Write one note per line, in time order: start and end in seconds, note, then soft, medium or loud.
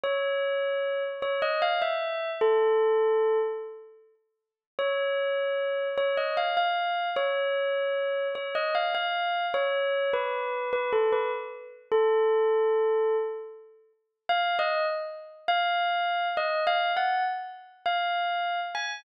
0.03 1.03 C#5 medium
1.22 1.41 C#5 medium
1.42 1.61 D#5 medium
1.62 1.81 F5 medium
1.82 2.30 E5 medium
2.41 3.38 A4 medium
4.79 5.88 C#5 medium
5.98 6.16 C#5 medium
6.17 6.36 D#5 medium
6.37 6.56 F5 medium
6.57 7.09 F5 medium
7.16 8.27 C#5 medium
8.35 8.54 C#5 medium
8.55 8.74 D#5 medium
8.75 8.94 F5 medium
8.95 9.46 F5 medium
9.54 10.10 C#5 medium
10.13 10.70 B4 medium
10.73 10.92 B4 medium
10.93 11.11 A4 medium
11.12 11.31 B4 medium
11.92 13.16 A4 medium
14.29 14.56 F5 medium
14.59 14.86 D#5 medium
15.48 16.28 F5 loud
16.37 16.64 D#5 medium
16.67 16.91 F5 medium
16.97 17.24 F#5 medium
17.86 18.60 F5 medium
18.75 19.00 G#5 medium